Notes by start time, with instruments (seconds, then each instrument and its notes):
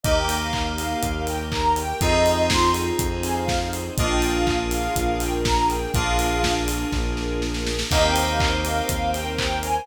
0.03 synth bass 1 D#2, electric piano 2 A#3 D#4 G4, string ensemble 1 A#3 D#4 G4, ocarina D#5, kick, closed hi-hat
0.17 ocarina G5
0.29 open hi-hat
0.41 ocarina F5
0.53 ocarina F5, kick, clap
0.77 ocarina F5, open hi-hat
1.02 synth bass 1 D#2, string ensemble 1 A#3 G4 A#4, kick, closed hi-hat
1.27 ocarina G5, open hi-hat
1.52 ocarina A#5, kick, clap
1.76 ocarina G5, open hi-hat
2.01 synth bass 1 F2, string ensemble 1 C4 D#4 F4 G#4, electric piano 2 C4 D#4 F4 G#4, ocarina D#5, kick, closed hi-hat
2.26 open hi-hat
2.50 ocarina C6, kick, snare
2.74 open hi-hat
2.99 synth bass 1 F2, string ensemble 1 C4 D#4 G#4 C5, kick, closed hi-hat
3.23 ocarina G#5, open hi-hat
3.36 ocarina F5
3.48 kick, snare
3.73 open hi-hat
3.97 synth bass 1 A#1, string ensemble 1 A#3 D4 F4 G#4, electric piano 2 A#3 D4 F4 G#4, ocarina D#5, kick, closed hi-hat
4.10 ocarina G5
4.22 open hi-hat
4.35 ocarina F5
4.47 ocarina F5, kick, clap
4.71 ocarina F5, open hi-hat
4.95 synth bass 1 A#1, string ensemble 1 A#3 D4 G#4 A#4, kick, closed hi-hat
5.20 ocarina G5, open hi-hat
5.45 ocarina A#5, kick, snare
5.70 ocarina G5, open hi-hat
5.94 synth bass 1 A#1, electric piano 2 A#3 D4 F4 G#4, string ensemble 1 A#3 D4 F4 G#4, ocarina F5, kick, closed hi-hat
6.19 open hi-hat
6.44 kick, snare
6.68 open hi-hat
6.92 synth bass 1 A#1, string ensemble 1 A#3 D4 G#4 A#4, kick, snare
7.17 snare
7.42 snare
7.54 snare
7.66 snare
7.79 snare
7.91 synth bass 1 D#2, electric piano 2 A#3 C4 D#4 G4, string ensemble 1 A#4 C5 D#5 G5, ocarina D#5, kick, crash
8.04 ocarina G5
8.16 open hi-hat
8.28 ocarina F5
8.40 ocarina F5, kick, clap
8.65 ocarina F5, open hi-hat
8.89 synth bass 1 D#2, string ensemble 1 A#4 C5 G5 A#5, kick, closed hi-hat
9.14 ocarina G5, open hi-hat
9.38 ocarina G5, kick, clap
9.63 ocarina G#5, open hi-hat